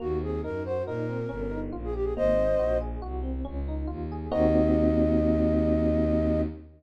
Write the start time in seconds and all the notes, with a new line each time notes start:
0.00 D#2 A#3 F#4
0.21 C4 G#4
0.43 F#2 D#4 A#4
0.65 F#4 C5
0.86 A#2 D#4 A#4
1.09 C4
1.29 G1 C#4
1.51 D#4
1.72 A#1 F4
1.84 G#4
1.93 G4
2.04 G#4
2.16 G#1 A#3 C5 D#5
2.36 C4
2.58 A#1 F#4
2.81 G#4
3.02 C2 F#4
3.23 C4
3.45 C#2 C#4
3.68 D#4
3.87 D#2 F4
4.12 G#4
4.31 D#2 A#3 C4 D#4 F#4 D#5